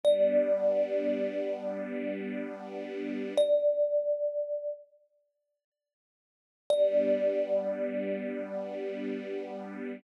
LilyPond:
<<
  \new Staff \with { instrumentName = "Kalimba" } { \time 4/4 \key g \lydian \tempo 4 = 72 d''1 | d''2 r2 | d''1 | }
  \new Staff \with { instrumentName = "String Ensemble 1" } { \time 4/4 \key g \lydian <g b d'>1 | r1 | <g b d'>1 | }
>>